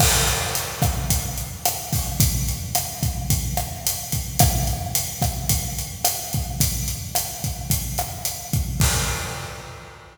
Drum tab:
CC |x-------|--------|--------|--------|
HH |-xxxxxxo|xxxxxxxx|xxxxxxxx|xxxxxxxx|
SD |r--r--r-|--r--r--|r--r--r-|--r--r--|
BD |o--oo--o|o--oo--o|o--oo--o|o--oo--o|

CC |x-------|
HH |--------|
SD |--------|
BD |o-------|